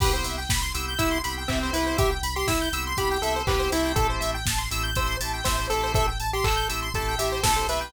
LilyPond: <<
  \new Staff \with { instrumentName = "Lead 1 (square)" } { \time 4/4 \key c \major \tempo 4 = 121 g'16 r4. r16 e'8 r8 c'8 e'8 | g'16 r8 g'16 e'8 r8 g'8 a'8 g'8 e'8 | a'16 r4. r16 c''8 r8 c''8 a'8 | a'16 r8 g'16 a'8 r8 a'8 g'8 a'8 b'8 | }
  \new Staff \with { instrumentName = "Drawbar Organ" } { \time 4/4 \key c \major <b c' e' g'>4. <b c' e' g'>8 <b c' e' g'>8 <b c' e' g'>8 <b c' e' g'>16 <b c' e' g'>16 <b c' e' g'>8~ | <b c' e' g'>4. <b c' e' g'>8 <b c' e' g'>8 <b c' e' g'>8 <b c' e' g'>16 <b c' e' g'>16 <a c' e' g'>8~ | <a c' e' g'>4. <a c' e' g'>8 <a c' e' g'>8 <a c' e' g'>8 <a c' e' g'>16 <a c' e' g'>16 <a c' e' g'>8~ | <a c' e' g'>4. <a c' e' g'>8 <a c' e' g'>8 <a c' e' g'>8 <a c' e' g'>16 <a c' e' g'>16 <a c' e' g'>8 | }
  \new Staff \with { instrumentName = "Lead 1 (square)" } { \time 4/4 \key c \major b'16 c''16 e''16 g''16 b''16 c'''16 e'''16 g'''16 e'''16 c'''16 b''16 g''16 e''16 c''16 b'16 c''16 | e''16 g''16 b''16 c'''16 e'''16 g'''16 e'''16 c'''16 b''16 g''16 e''16 c''16 b'16 c''16 e''16 g''16 | a'16 c''16 e''16 g''16 a''16 c'''16 e'''16 g'''16 e'''16 c'''16 a''16 g''16 e''16 c''16 a'16 c''16 | e''16 g''16 a''16 c'''16 e'''16 g'''16 e'''16 c'''16 a''16 g''16 e''16 c''16 a'16 c''16 e''16 g''16 | }
  \new Staff \with { instrumentName = "Synth Bass 2" } { \clef bass \time 4/4 \key c \major c,8 c,8 c,8 c,8 c,8 c,8 c,8 c,8 | c,8 c,8 c,8 c,8 c,8 c,8 c,8 c,8 | a,,8 a,,8 a,,8 a,,8 a,,8 a,,8 a,,8 a,,8 | a,,8 a,,8 a,,8 a,,8 a,,8 a,,8 ais,,8 b,,8 | }
  \new DrumStaff \with { instrumentName = "Drums" } \drummode { \time 4/4 <cymc bd>8 hho8 <bd sn>8 hho8 <hh bd>8 hho8 <hc bd>8 hho8 | <hh bd>8 hho8 <bd sn>8 hho8 <hh bd>8 hho8 <hc bd>8 hho8 | <hh bd>8 hho8 <bd sn>8 hho8 <hh bd>8 hho8 <bd sn>8 hho8 | <hh bd>8 hho8 <hc bd>8 hho8 <hh bd>8 hho8 <bd sn>8 hho8 | }
>>